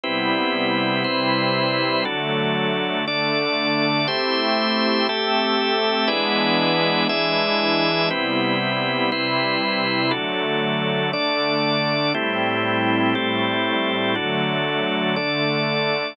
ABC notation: X:1
M:4/4
L:1/8
Q:1/4=119
K:Ador
V:1 name="Pad 5 (bowed)"
[C,G,B,E]4 [C,G,CE]4 | [D,F,A,]4 [D,A,D]4 | [A,CEG]4 [A,CGA]4 | [E,^G,B,D]4 [E,G,DE]4 |
[C,G,B,E]4 [C,G,CE]4 | [D,F,A,]4 [D,A,D]4 | [A,,G,CE]4 [A,,G,A,E]4 | [D,F,A,]4 [D,A,D]4 |]
V:2 name="Drawbar Organ"
[CEGB]4 [CEBc]4 | [DFA]4 [DAd]4 | [A,Gce]4 [A,GAe]4 | [E^GBd]4 [EGde]4 |
[CEGB]4 [CEBc]4 | [DFA]4 [DAd]4 | [A,CEG]4 [A,CGA]4 | [DFA]4 [DAd]4 |]